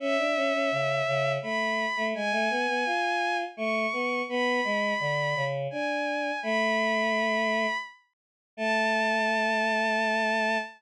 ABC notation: X:1
M:3/4
L:1/16
Q:1/4=84
K:A
V:1 name="Violin"
e8 b4 | g8 c'4 | b8 g4 | b8 z4 |
a12 |]
V:2 name="Choir Aahs"
C D C C C,2 C,2 A,3 A, | G, A, B, B, ^E4 A,2 B,2 | B,2 G,2 D,2 C,2 D4 | A,8 z4 |
A,12 |]